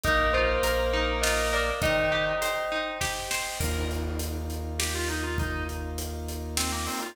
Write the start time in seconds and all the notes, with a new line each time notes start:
0.03 A#1 A#3 D#4 A#4 D#5 F5, kick, closed hi-hat
0.33 F4 C5
0.63 A#1 A#4, closed hi-hat
0.93 D#4
1.21 F4 D#5, snare
1.53 A#4 D5
1.82 D#3 D#4 C5 D#5 G5, kick, closed hi-hat
2.12 G4
2.42 C5, closed hi-hat
2.72 D#4
3.01 G4, kick, snare
3.31 C5, snare
3.60 D#2 A#3 D#4 F4 A#4, kick, crash
3.91 closed hi-hat
4.19 closed hi-hat
4.50 closed hi-hat
4.79 G4, snare
4.95 F4
5.08 D#4, closed hi-hat
5.23 F4
5.38 D#4, kick, closed hi-hat
5.69 closed hi-hat
5.98 closed hi-hat
6.28 closed hi-hat
6.57 C4, snare
6.72 A#3
6.86 C4, open hi-hat
7.02 F4